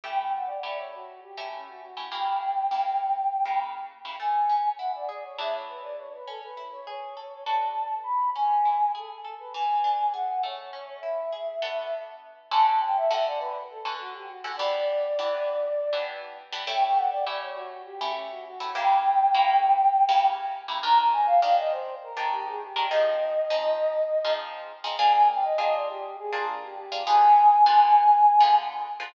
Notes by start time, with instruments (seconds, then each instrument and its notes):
0.03 acoustic guitar (steel) A3 C#4 E4 G4, flute G5
0.16 flute G5
0.35 flute F#5
0.46 flute D5
0.63 acoustic guitar (steel) A3 C#4 E4 G4, flute D5
0.77 flute C#5
0.93 flute F#4
1.22 flute G4
1.37 acoustic guitar (steel) A3 C#4 E4 G4
1.54 flute C#4
1.68 flute F#4
1.82 flute F#4
1.97 acoustic guitar (steel) A3 C#4 E4 G4
2.12 acoustic guitar (steel) C#3 A#3 E4 G4, flute G5
2.71 acoustic guitar (steel) C#3 A#3 E4 G4
3.45 acoustic guitar (steel) C#3 A#3 E4 G4
4.05 acoustic guitar (steel) C#3 A#3 E4 G4
4.19 acoustic guitar (steel) A3, flute G#5
4.49 acoustic guitar (steel) C#4
4.78 acoustic guitar (steel) E4, flute F#5
4.95 flute D5
5.09 acoustic guitar (steel) G#4, flute D5
5.24 flute C#5
5.38 acoustic guitar (steel) E3 B3 D4 G#4, flute E5
5.55 flute C#5
5.69 flute B4
5.83 flute D5
5.97 flute C#5
6.14 flute B4
6.27 acoustic guitar (steel) C#4, flute A4
6.43 flute B4
6.57 acoustic guitar (steel) E4
6.72 flute C#5
6.87 acoustic guitar (steel) G#4, flute C#5
7.16 acoustic guitar (steel) A4
7.46 acoustic guitar (steel) D4 F#4 A4 B4, flute A5
8.03 flute B5
8.35 acoustic guitar (steel) C#4, flute G#5
8.65 acoustic guitar (steel) E4
8.95 acoustic guitar (steel) G#4, flute A4
9.24 acoustic guitar (steel) A4
9.39 flute B4
9.54 acoustic guitar (steel) E3, flute G#5
9.84 acoustic guitar (steel) D4
10.13 acoustic guitar (steel) G#4, flute F#5
10.43 acoustic guitar (steel) A3, flute C#5
10.73 acoustic guitar (steel) C#4
11.00 acoustic guitar (steel) E4, flute E5
11.32 acoustic guitar (steel) G#4
11.62 acoustic guitar (steel) B3 D4 F#4 A4
12.51 acoustic guitar (steel) D3 C#4 F#4 A4, flute A5
12.67 flute A5
12.80 flute G5
12.97 flute E5
13.11 acoustic guitar (steel) D3 C#4 F#4 A4, flute E5
13.25 flute D5
13.39 flute B4
13.70 flute A4
13.85 acoustic guitar (steel) D3 C#4 F#4 A4
14.00 flute F#4
14.14 flute G4
14.29 flute F#4
14.44 acoustic guitar (steel) D3 C#4 F#4 A4
14.57 acoustic guitar (steel) E3 B3 D4 G4, flute D5
15.18 acoustic guitar (steel) E3 B3 D4 G4
15.93 acoustic guitar (steel) E3 B3 D4 G4
16.52 acoustic guitar (steel) E3 B3 D4 G4
16.67 acoustic guitar (steel) A3 C#4 E4 G4, flute G5
16.82 flute G5
16.96 flute F#5
17.10 flute D5
17.26 acoustic guitar (steel) A3 C#4 E4 G4, flute D5
17.42 flute C#5
17.55 flute F#4
17.85 flute G4
18.01 acoustic guitar (steel) A3 C#4 E4 G4
18.15 flute C#4
18.31 flute F#4
18.46 flute F#4
18.60 acoustic guitar (steel) A3 C#4 E4 G4
18.75 acoustic guitar (steel) C#3 A#3 E4 G4, flute G5
19.34 acoustic guitar (steel) C#3 A#3 E4 G4
20.09 acoustic guitar (steel) C#3 A#3 E4 G4
20.68 acoustic guitar (steel) C#3 A#3 E4 G4
20.83 acoustic guitar (steel) D#3 D4 G4 A#4, flute A#5
20.99 flute A#5
21.12 flute G#5
21.26 flute F5
21.42 acoustic guitar (steel) D#3 D4 G4 A#4, flute F5
21.58 flute D#5
21.71 flute C5
22.03 flute A#4
22.16 acoustic guitar (steel) D#3 D4 G4 A#4
22.32 flute G4
22.47 flute G#4
22.62 flute G4
22.76 acoustic guitar (steel) D#3 D4 G4 A#4
22.89 acoustic guitar (steel) F3 C4 D#4 G#4, flute D#5
23.50 acoustic guitar (steel) F3 C4 D#4 G#4
24.24 acoustic guitar (steel) F3 C4 D#4 G#4
24.84 acoustic guitar (steel) F3 C4 D#4 G#4
24.98 acoustic guitar (steel) A#3 D4 F4 G#4, flute G#5
25.14 flute G#5
25.28 flute G5
25.43 flute D#5
25.58 acoustic guitar (steel) A#3 D4 F4 G#4, flute D#5
25.73 flute D5
25.89 flute G4
26.18 flute G#4
26.32 acoustic guitar (steel) A#3 D4 F4 G#4
26.48 flute D4
26.62 flute G4
26.76 flute G4
26.92 acoustic guitar (steel) A#3 D4 F4 G#4
27.07 acoustic guitar (steel) D3 B3 F4 G#4, flute G#5
27.66 acoustic guitar (steel) D3 B3 F4 G#4
28.40 acoustic guitar (steel) D3 B3 F4 G#4
29.00 acoustic guitar (steel) D3 B3 F4 G#4